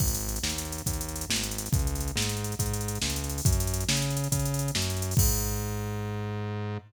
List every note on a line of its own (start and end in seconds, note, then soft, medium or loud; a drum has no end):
0.00 0.39 G#1 medium
0.00 kick medium
0.00 crash medium
0.08 closed hi-hat medium
0.15 closed hi-hat medium
0.21 closed hi-hat medium
0.29 closed hi-hat medium
0.36 closed hi-hat medium
0.43 0.82 D#2 medium
0.43 snare medium
0.50 closed hi-hat medium
0.58 closed hi-hat medium
0.65 closed hi-hat medium
0.72 closed hi-hat medium
0.78 closed hi-hat medium
0.86 1.25 D#2 medium
0.86 kick medium
0.86 closed hi-hat medium
0.93 closed hi-hat medium
1.01 closed hi-hat medium
1.09 closed hi-hat medium
1.16 closed hi-hat medium
1.21 closed hi-hat medium
1.29 1.68 G#1 medium
1.29 snare loud
1.36 closed hi-hat medium
1.43 closed hi-hat medium
1.51 closed hi-hat medium
1.58 closed hi-hat medium
1.66 closed hi-hat medium
1.72 2.11 C#2 medium
1.72 kick loud
1.72 closed hi-hat medium
1.79 closed hi-hat medium
1.87 closed hi-hat medium
1.95 closed hi-hat medium
2.00 closed hi-hat medium
2.08 closed hi-hat medium
2.16 2.54 G#2 medium
2.16 snare loud
2.22 closed hi-hat medium
2.29 closed hi-hat medium
2.37 closed hi-hat medium
2.44 closed hi-hat medium
2.52 closed hi-hat medium
2.59 2.98 G#2 medium
2.59 kick medium
2.59 closed hi-hat medium
2.66 closed hi-hat medium
2.74 closed hi-hat medium
2.81 closed hi-hat medium
2.88 closed hi-hat medium
2.95 closed hi-hat medium
3.02 3.41 C#2 medium
3.02 snare loud
3.10 closed hi-hat medium
3.16 closed hi-hat medium
3.24 closed hi-hat medium
3.29 closed hi-hat medium
3.38 open hi-hat medium
3.45 3.84 F#2 loud
3.45 kick loud
3.45 closed hi-hat loud
3.52 closed hi-hat medium
3.60 closed hi-hat medium
3.67 closed hi-hat medium
3.74 closed hi-hat medium
3.81 closed hi-hat medium
3.89 4.28 C#3 medium
3.89 snare loud
3.97 closed hi-hat medium
4.02 closed hi-hat medium
4.10 closed hi-hat medium
4.17 closed hi-hat medium
4.24 closed hi-hat medium
4.32 4.71 C#3 medium
4.32 kick medium
4.32 closed hi-hat loud
4.39 closed hi-hat medium
4.46 closed hi-hat medium
4.54 closed hi-hat medium
4.59 closed hi-hat medium
4.68 closed hi-hat medium
4.75 5.14 F#2 medium
4.75 snare loud
4.82 closed hi-hat medium
4.90 closed hi-hat medium
4.97 closed hi-hat medium
5.02 closed hi-hat medium
5.11 open hi-hat medium
5.17 6.77 G#2 loud
5.17 kick loud
5.17 crash loud